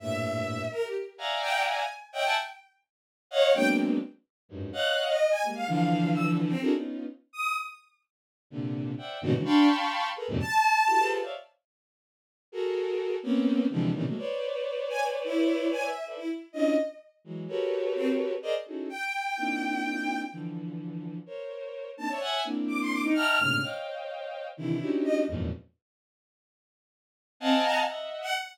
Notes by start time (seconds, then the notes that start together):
0.00 G2 A2 A#2 E5
0.71 A#4
0.83 G4
1.18 D5 E5 F5 F#5 G#5 A#5
1.41 G5
1.66 G#5
2.13 C#5 D#5 E5 F#5 G5
2.24 E5 F#5 G#5 A5
3.31 C#5 D#5 F5 F#5
3.54 F#3 G#3 A#3 B3 C4 D4 G5
4.49 F#2 G2 G#2
4.73 C#5 D#5 F5 F#5 F#6
5.08 D#5
5.30 G#5
5.43 G3 G#3 A#3
5.55 F5
5.67 D3 E3 F3 F5
6.13 E6
6.48 C4
6.61 D4 E4 F#4 G#4 A4 A#4
6.73 B3 C#4 D#4 F4
7.33 D#6
8.50 A#2 C3 D3
8.98 C5 D5 E5 F#5 G5
9.21 G2 G#2 A#2 B2 C#3 D#3 F#4
9.33 C#3 D3 E3 F#3 G#3
9.45 D4 F5 G5 A5 B5 C6 C#6
10.16 G#4 A4 A#4 B4
10.28 F2 F#2 G#2 A#2 C3
10.40 A5
10.87 E4 F#4 G4 A4
10.98 F4 G4 G#4 A4 B4 C5
11.22 C5 C#5 D5 E5 F5
12.52 F#4 G#4 A4 A#4
13.23 A#3 B3 C4 C#4
13.70 C3 D3 E3 F3 G3 G#3
13.94 A#2 C3 C#3 D#3 E3
14.05 F#3 G#3 A3 A#3
14.17 B4 C5 C#5 D5
14.90 G#5
15.24 E4
15.72 G#5
15.83 E5
16.06 A4 B4 C5 D5 E5
16.16 E4
16.53 C#4 D4 E4 F4 D#5
17.24 E3 F#3 G#3
17.48 F#4 G4 A4 A#4 B4 C#5
17.95 C4
18.42 G#4 A#4 C5 D5 D#5
18.66 C#4 D#4 E4 F#4 G#4 A4
18.89 G5
19.37 A#3 C4 D4 D#4 E4 F4
20.31 D3 E3 F3
21.26 A#4 C5 C#5
21.97 A#3 C4 D4 D#4 A5
22.09 C5 C#5 D5 E5
22.20 E5 F#5 G#5
22.44 A#3 C4 D4 E4
22.68 D6
22.80 C6
22.90 D6
23.03 D#4
23.14 D#5 E5 F#5 G5 A5 A#5 F6
23.39 G#2 A2 A#2 C3 C#3 D3
23.62 C5 C#5 D#5 F5 G5
24.57 C3 D3 D#3 E3 E4
24.80 C#4 D4 D#4 E4 F#4 G4
25.04 D#5
25.27 E2 F2 F#2 G#2 A#2
27.40 C4 D#5 F5 F#5 G#5 A5
27.64 A#5
27.87 D#5 E5 F#5
28.22 F#5